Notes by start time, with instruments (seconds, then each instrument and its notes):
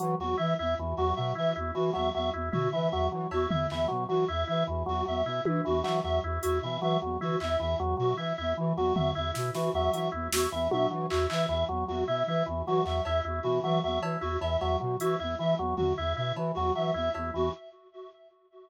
0.00 flute E3, drawbar organ F#3, closed hi-hat
0.19 flute E2, drawbar organ F#3, clarinet F#4
0.37 flute E3, drawbar organ E4, clarinet E5
0.59 flute E2, drawbar organ E4, clarinet E5
0.78 flute E2, drawbar organ E3
0.97 flute E2, drawbar organ F#3, clarinet F#4
1.16 flute B2, drawbar organ F#3, clarinet E5
1.35 flute E3, drawbar organ E4, clarinet E5
1.56 flute E2, drawbar organ E4
1.75 drawbar organ E3, flute E3, clarinet F#4
1.93 flute E2, drawbar organ F#3, clarinet E5, cowbell
2.14 flute E2, drawbar organ F#3, clarinet E5
2.33 flute E2, drawbar organ E4
2.52 flute B2, drawbar organ E4, clarinet F#4, floor tom
2.72 drawbar organ E3, flute E3, clarinet E5
2.91 flute E2, drawbar organ F#3, clarinet E5
3.11 flute E3, drawbar organ F#3
3.31 flute E2, drawbar organ E4, clarinet F#4, cowbell
3.49 flute E2, drawbar organ E4, clarinet E5, floor tom
3.70 flute E2, drawbar organ E3, clarinet E5, clap
3.88 flute B2, drawbar organ F#3
4.09 flute E3, drawbar organ F#3, clarinet F#4
4.28 flute E2, drawbar organ E4, clarinet E5
4.47 flute E3, drawbar organ E4, clarinet E5
4.67 flute E2, drawbar organ E3
4.86 flute E2, drawbar organ F#3, clarinet F#4
5.06 flute E2, drawbar organ F#3, clarinet E5
5.25 flute B2, drawbar organ E4, clarinet E5
5.45 flute E3, drawbar organ E4, high tom
5.65 flute E2, drawbar organ E3, clarinet F#4
5.83 flute E3, drawbar organ F#3, clarinet E5, clap
6.04 flute E2, drawbar organ F#3, clarinet E5
6.23 flute E2, drawbar organ E4
6.42 flute E2, drawbar organ E4, clarinet F#4, closed hi-hat
6.62 flute B2, drawbar organ E3, clarinet E5
6.81 flute E3, drawbar organ F#3, clarinet E5
7.02 flute E2, drawbar organ F#3
7.20 flute E3, drawbar organ E4, clarinet F#4, floor tom
7.40 flute E2, drawbar organ E4, clarinet E5, clap
7.59 flute E2, drawbar organ E3, clarinet E5
7.79 flute E2, drawbar organ F#3
7.97 flute B2, drawbar organ F#3, clarinet F#4
8.17 flute E3, drawbar organ E4, clarinet E5
8.37 flute E2, drawbar organ E4, clarinet E5
8.57 flute E3, drawbar organ E3
8.76 flute E2, drawbar organ F#3, clarinet F#4
8.95 flute E2, drawbar organ F#3, clarinet E5, floor tom
9.15 flute E2, drawbar organ E4, clarinet E5
9.34 flute B2, drawbar organ E4, snare
9.54 flute E3, drawbar organ E3, clarinet F#4, snare
9.73 flute E2, drawbar organ F#3, clarinet E5
9.92 flute E3, drawbar organ F#3, clarinet E5, closed hi-hat
10.12 flute E2, drawbar organ E4
10.31 flute E2, drawbar organ E4, clarinet F#4, snare
10.52 flute E2, drawbar organ E3, clarinet E5
10.71 flute B2, drawbar organ F#3, clarinet E5, high tom
10.91 flute E3, drawbar organ F#3
11.10 flute E2, drawbar organ E4, clarinet F#4, clap
11.30 flute E3, drawbar organ E4, clarinet E5, clap
11.48 flute E2, drawbar organ E3, clarinet E5
11.69 flute E2, drawbar organ F#3
11.88 flute E2, drawbar organ F#3, clarinet F#4
12.07 flute B2, drawbar organ E4, clarinet E5
12.27 flute E3, drawbar organ E4, clarinet E5
12.46 flute E2, drawbar organ E3
12.66 flute E3, drawbar organ F#3, clarinet F#4
12.85 flute E2, drawbar organ F#3, clarinet E5, clap
13.05 flute E2, drawbar organ E4, clarinet E5, cowbell
13.24 flute E2, drawbar organ E4
13.43 flute B2, drawbar organ E3, clarinet F#4
13.64 flute E3, drawbar organ F#3, clarinet E5
13.83 flute E2, drawbar organ F#3, clarinet E5
14.01 flute E3, drawbar organ E4, cowbell
14.21 flute E2, drawbar organ E4, clarinet F#4
14.41 flute E2, drawbar organ E3, clarinet E5, cowbell
14.60 flute E2, drawbar organ F#3, clarinet E5, cowbell
14.80 flute B2, drawbar organ F#3
15.00 flute E3, drawbar organ E4, clarinet F#4, closed hi-hat
15.19 flute E2, drawbar organ E4, clarinet E5
15.39 flute E3, drawbar organ E3, clarinet E5
15.58 flute E2, drawbar organ F#3
15.77 flute E2, drawbar organ F#3, clarinet F#4, floor tom
15.97 flute E2, drawbar organ E4, clarinet E5
16.16 flute B2, drawbar organ E4, clarinet E5
16.36 flute E3, drawbar organ E3, cowbell
16.55 flute E2, drawbar organ F#3, clarinet F#4
16.75 flute E3, drawbar organ F#3, clarinet E5
16.94 flute E2, drawbar organ E4, clarinet E5
17.14 flute E2, drawbar organ E4, cowbell
17.34 flute E2, drawbar organ E3, clarinet F#4